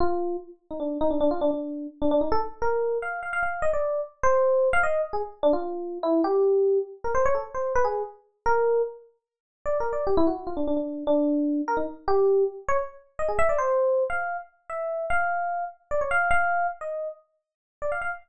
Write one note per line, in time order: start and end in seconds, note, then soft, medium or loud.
0.00 0.37 F4 loud
0.71 0.80 D#4 soft
0.80 0.98 D4 medium
1.01 1.10 D#4 loud
1.10 1.19 D4 medium
1.21 1.30 D4 loud
1.31 1.40 F4 medium
1.41 1.50 D4 medium
1.51 1.87 D4 medium
2.02 2.11 D4 medium
2.11 2.20 D4 loud
2.21 2.30 D#4 medium
2.32 2.41 A4 loud
2.62 2.98 A#4 medium
3.02 3.20 F5 medium
3.23 3.32 F5 medium
3.33 3.42 F5 medium
3.43 3.61 F5 medium
3.62 3.71 D#5 medium
3.73 4.01 D5 medium
4.23 4.69 C5 loud
4.73 4.82 F5 loud
4.83 5.01 D#5 medium
5.13 5.22 G#4 medium
5.43 5.52 D4 loud
5.53 5.98 F4 medium
6.03 6.21 E4 loud
6.24 6.79 G4 loud
7.04 7.13 A#4 medium
7.15 7.24 C5 medium
7.26 7.35 C#5 loud
7.35 7.44 A4 medium
7.55 7.73 C5 medium
7.76 7.85 B4 loud
7.84 8.03 G#4 medium
8.46 8.82 A#4 loud
9.66 9.78 D5 medium
9.80 9.92 A#4 medium
9.93 10.05 D5 soft
10.07 10.16 G4 medium
10.17 10.26 E4 loud
10.27 10.36 F#4 medium
10.47 10.56 F4 medium
10.57 10.66 D4 medium
10.67 10.76 D4 medium
10.77 11.04 D4 soft
11.07 11.61 D4 loud
11.68 11.77 A#4 medium
11.77 11.86 D#4 medium
12.08 12.44 G4 loud
12.68 12.78 C#5 loud
13.19 13.28 D#5 medium
13.28 13.38 G#4 medium
13.39 13.48 E5 loud
13.49 13.58 D5 medium
13.58 14.04 C5 loud
14.10 14.37 F5 medium
14.70 15.06 E5 medium
15.10 15.65 F5 medium
15.91 16.00 D5 medium
16.01 16.10 C#5 medium
16.11 16.29 F5 loud
16.31 16.67 F5 loud
16.81 17.08 D#5 medium
17.82 17.91 D5 medium
17.92 18.01 F5 medium
18.02 18.11 F5 medium